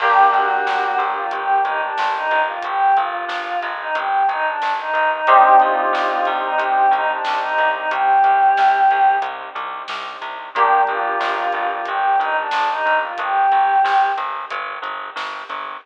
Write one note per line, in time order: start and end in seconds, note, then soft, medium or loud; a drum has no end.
0.00 0.27 G1 medium
0.00 5.18 A#3 loud
0.00 5.18 D4 loud
0.00 0.30 G4 loud
0.00 5.18 G4 loud
0.00 kick loud
0.00 crash loud
0.32 0.60 G1 medium
0.32 0.98 F#4 loud
0.32 closed hi-hat medium
0.66 0.94 G1 medium
0.66 snare loud
0.98 1.26 G1 medium
0.98 closed hi-hat medium
1.16 1.31 F4 loud
1.31 1.60 G1 medium
1.31 1.62 G4 loud
1.31 kick medium
1.31 closed hi-hat loud
1.65 1.93 G1 medium
1.65 1.80 D#4 medium
1.65 kick medium
1.65 closed hi-hat medium
1.81 2.12 D4 medium
1.98 2.27 G1 medium
1.98 snare loud
2.15 2.41 D#4 medium
2.31 2.59 G1 medium
2.31 closed hi-hat medium
2.47 2.63 F4 loud
2.63 2.92 G1 medium
2.63 2.96 G4 loud
2.63 kick loud
2.63 closed hi-hat loud
2.96 3.25 G1 medium
2.96 3.66 F4 medium
2.96 closed hi-hat medium
3.28 3.56 G1 medium
3.28 snare loud
3.63 3.91 G1 medium
3.63 closed hi-hat medium
3.79 3.95 D#4 medium
3.95 4.23 G1 medium
3.95 4.26 G4 medium
3.95 kick loud
3.95 closed hi-hat loud
4.28 4.56 G1 medium
4.28 4.46 D#4 loud
4.28 kick medium
4.28 closed hi-hat medium
4.46 4.73 D4 loud
4.62 4.90 G1 medium
4.62 snare loud
4.78 5.10 D#4 medium
4.93 5.21 G1 medium
4.93 kick loud
4.93 closed hi-hat medium
5.11 5.27 D#4 loud
5.27 5.55 C2 medium
5.27 10.44 C4 loud
5.27 10.44 D4 medium
5.27 10.44 D#4 loud
5.27 10.44 G4 loud
5.27 5.56 G4 loud
5.27 kick loud
5.27 closed hi-hat loud
5.60 5.89 C2 medium
5.60 6.29 F4 loud
5.60 closed hi-hat medium
5.93 6.21 C2 medium
5.93 snare loud
6.25 6.55 C2 medium
6.25 closed hi-hat medium
6.43 6.58 D#4 loud
6.58 6.86 C2 medium
6.58 6.91 G4 loud
6.58 kick medium
6.58 closed hi-hat loud
6.91 7.19 C2 medium
6.91 7.09 D#4 loud
6.91 kick medium
6.91 closed hi-hat medium
7.09 7.39 D4 medium
7.25 7.55 C2 medium
7.25 snare loud
7.40 7.69 D#4 loud
7.58 7.86 C2 medium
7.58 closed hi-hat medium
7.74 7.89 D#4 medium
7.89 8.19 C2 medium
7.89 9.15 G4 loud
7.89 kick loud
7.89 closed hi-hat loud
8.24 8.52 C2 medium
8.24 closed hi-hat medium
8.57 8.86 C2 medium
8.57 snare loud
8.91 9.19 C2 medium
8.91 closed hi-hat medium
9.22 9.50 C2 medium
9.22 kick medium
9.22 closed hi-hat loud
9.55 9.83 C2 medium
9.55 closed hi-hat medium
9.88 10.17 C2 medium
9.88 snare loud
10.21 10.50 C2 medium
10.21 kick medium
10.21 closed hi-hat medium
10.55 10.83 G1 medium
10.55 15.72 A#3 loud
10.55 15.72 D4 medium
10.55 10.81 G4 loud
10.55 15.72 G4 loud
10.55 kick loud
10.55 closed hi-hat loud
10.87 11.16 G1 medium
10.87 11.67 F4 loud
10.87 closed hi-hat medium
11.20 11.48 G1 medium
11.20 snare loud
11.52 11.81 G1 medium
11.52 closed hi-hat medium
11.70 11.85 F4 loud
11.86 12.16 G1 medium
11.86 12.18 G4 medium
11.86 kick loud
11.86 closed hi-hat loud
12.20 12.48 G1 medium
12.20 12.36 D#4 loud
12.20 kick loud
12.20 closed hi-hat medium
12.38 12.69 D4 loud
12.51 12.81 G1 medium
12.51 snare loud
12.70 12.97 D#4 loud
12.86 13.13 G1 medium
12.86 closed hi-hat medium
13.02 13.18 F4 medium
13.18 13.47 G1 medium
13.18 14.08 G4 loud
13.18 kick loud
13.18 closed hi-hat loud
13.52 13.80 G1 medium
13.52 closed hi-hat medium
13.84 14.12 G1 medium
13.84 snare loud
14.17 14.45 G1 medium
14.17 closed hi-hat medium
14.51 14.79 G1 medium
14.51 kick medium
14.51 closed hi-hat loud
14.82 15.10 G1 medium
14.82 kick medium
14.82 closed hi-hat medium
15.16 15.44 G1 medium
15.16 snare loud
15.49 15.77 G1 medium
15.49 kick medium
15.49 closed hi-hat medium